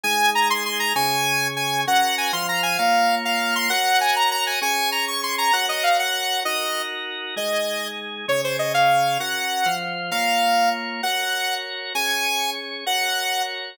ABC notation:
X:1
M:6/8
L:1/8
Q:3/8=131
K:Abmix
V:1 name="Lead 2 (sawtooth)"
a2 b c' c' b | a4 a2 | g2 a c' b a | f3 f2 c' |
g2 a b b a | a2 b d' c' b | g e f g3 | e3 z3 |
e4 z2 | d c e f3 | g4 z2 | f4 z2 |
g4 z2 | a4 z2 | g4 z2 |]
V:2 name="Drawbar Organ"
[A,EA]6 | [D,DA]6 | [DGB]3 [F,Fc]3 | [B,Fd]6 |
[GBd]6 | [DAd]6 | [GBd]6 | [EGB]6 |
[A,EA]6 | [D,DA]6 | [DGB]3 [F,Fc]3 | [B,Fd]6 |
[GBd]6 | [DAd]6 | [GBd]6 |]